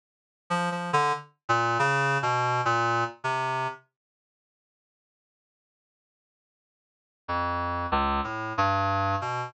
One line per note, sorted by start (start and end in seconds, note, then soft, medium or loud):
0.50 0.69 F3 medium
0.72 0.91 F3 medium
0.93 1.12 D3 loud
1.49 1.78 A#2 loud
1.79 2.18 C#3 loud
2.22 2.61 B2 loud
2.65 3.04 A#2 loud
3.24 3.67 C3 medium
7.28 7.86 F2 medium
7.92 8.21 C#2 loud
8.24 8.53 A2 soft
8.58 9.16 G2 loud
9.21 9.50 B2 medium